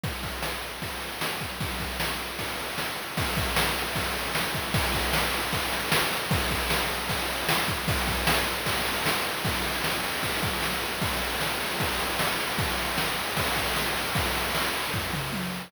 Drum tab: CC |----------------|----------------|----------------|----------------|
RD |x-x---x-x-x---x-|x-x---x-x-x---x-|x-x---x-x-x---x-|x-x---x-x-x---x-|
SD |----o-------o---|----o-------o---|----o-------o---|----o-------o---|
T1 |----------------|----------------|----------------|----------------|
T2 |----------------|----------------|----------------|----------------|
FT |----------------|----------------|----------------|----------------|
BD |o-o-----o-----o-|o-o-----o-------|o-o-----o-----o-|o-o-----o-------|

CC |----------------|----------------|x---------------|----------------|
RD |x-x---x-x-x---x-|x-x---x-x-x---x-|-xxx-xxxxxxx-xxx|xxxx-xxxxxxx-xxx|
SD |----o-------o---|----o-------o---|----o-------o---|----o-------o---|
T1 |----------------|----------------|----------------|----------------|
T2 |----------------|----------------|----------------|----------------|
FT |----------------|----------------|----------------|----------------|
BD |o-o-----o-----o-|o-o-----o-------|o-------o-o-----|o-------o-------|

CC |----------------|----------------|
RD |xxxx-xxxxxxx-xxx|xxxx-xxx--------|
SD |----o-------o---|----o-----------|
T1 |----------------|------------o---|
T2 |----------------|----------o-----|
FT |----------------|--------o-------|
BD |o-------o-o-----|o-------o-------|